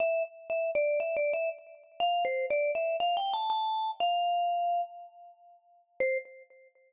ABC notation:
X:1
M:4/4
L:1/8
Q:1/4=120
K:C
V:1 name="Vibraphone"
e z e d (3e d e z2 | f c d e (3f g a a2 | f4 z4 | c2 z6 |]